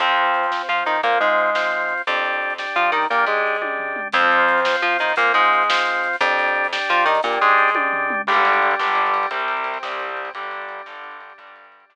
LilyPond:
<<
  \new Staff \with { instrumentName = "Overdriven Guitar" } { \time 6/8 \key f \mixolydian \tempo 4. = 116 <f c'>2 f'8 ees'8 | bes8 aes2~ aes8 | r2 f'8 ees'8 | bes8 aes2~ aes8 |
<f c'>2 f'8 ees'8 | bes8 aes2~ aes8 | r2 f'8 ees'8 | bes8 aes2~ aes8 |
\key g \mixolydian <g, d g>4. <g, d g>4. | <c, c g>4. <c, c g>4. | <g, d g>4. <g, d g>4. | <g, d g>4. <g, d g>4. | }
  \new Staff \with { instrumentName = "Drawbar Organ" } { \time 6/8 \key f \mixolydian <c' f'>4. <c' f'>4. | <c' f'>4. <c' f'>4. | <d' g'>4. <d' g'>4. | <d' g'>4. <d' g'>4. |
<c' f'>4. <c' f'>4. | <c' f'>4. <c' f'>4. | <d' g'>4. <d' g'>4. | <d' g'>4. <d' g'>4. |
\key g \mixolydian <g d' g'>2. | <c c' g'>2. | <g d' g'>2~ <g d' g'>8 <g d' g'>8~ | <g d' g'>2. | }
  \new Staff \with { instrumentName = "Electric Bass (finger)" } { \clef bass \time 6/8 \key f \mixolydian f,2 f8 ees8 | bes,8 aes,2~ aes,8 | f,2 f8 ees8 | bes,8 aes,2~ aes,8 |
f,2 f8 ees8 | bes,8 aes,2~ aes,8 | f,2 f8 ees8 | bes,8 aes,2~ aes,8 |
\key g \mixolydian r2. | r2. | r2. | r2. | }
  \new DrumStaff \with { instrumentName = "Drums" } \drummode { \time 6/8 <hh bd>16 hh16 hh16 hh16 hh16 hh16 sn16 hh16 hh16 hh16 hh16 hh16 | <hh bd>16 hh16 hh16 hh16 hh16 hh16 sn16 hh16 hh16 hh16 hh16 hh16 | <hh bd>16 hh16 hh16 hh16 hh16 hh16 sn16 hh16 hh16 hh16 hh16 hh16 | <hh bd>16 hh16 hh16 hh16 hh16 hh16 <bd tommh>8 tomfh8 toml8 |
<hh bd>16 hh16 hh16 hh16 hh16 hh16 sn16 hh16 hh16 hh16 hh16 hh16 | <hh bd>16 hh16 hh16 hh16 hh16 hh16 sn16 hh16 hh16 hh16 hh16 hh16 | <hh bd>16 hh16 hh16 hh16 hh16 hh16 sn16 hh16 hh16 hh16 hh16 hh16 | <hh bd>16 hh16 hh16 hh16 hh16 hh16 <bd tommh>8 tomfh8 toml8 |
<cymc bd>16 cymr16 cymr16 cymr16 cymr16 cymr16 sn16 cymr16 cymr16 cymr16 cymr16 cymr16 | <bd cymr>16 cymr16 cymr16 cymr16 cymr16 cymr16 sn16 cymr16 cymr16 cymr16 cymr16 cymr16 | <bd cymr>16 cymr16 cymr16 cymr16 cymr16 cymr16 sn16 cymr16 cymr16 cymr16 cymr16 cymr16 | <bd cymr>16 cymr16 cymr16 cymr16 cymr16 cymr16 sn4. | }
>>